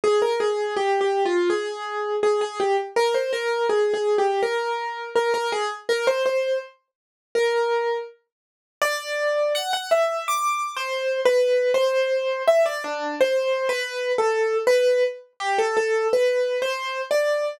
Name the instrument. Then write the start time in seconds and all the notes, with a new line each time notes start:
acoustic grand piano
0.04 G#4
0.22 A#4
0.40 G#4
0.77 G4
1.01 G4
1.25 F4
1.50 G#4
2.23 G#4
2.41 G#4
2.60 G4
2.96 A#4
3.14 C5
3.33 A#4
3.69 G#4
3.94 G#4
4.18 G4
4.43 A#4
5.16 A#4
5.34 A#4
5.52 G#4
5.89 A#4
6.07 C5
6.26 C5
7.35 A#4
8.82 D5
9.55 F#5
9.73 F#5
9.91 E5
10.28 D6
10.77 C5
11.25 B4
11.74 C5
12.48 E5
12.66 D5
12.84 D4
13.21 C5
13.69 B4
14.18 A4
14.67 B4
15.40 G4
15.58 A4
15.77 A4
16.13 B4
16.62 C5
17.11 D5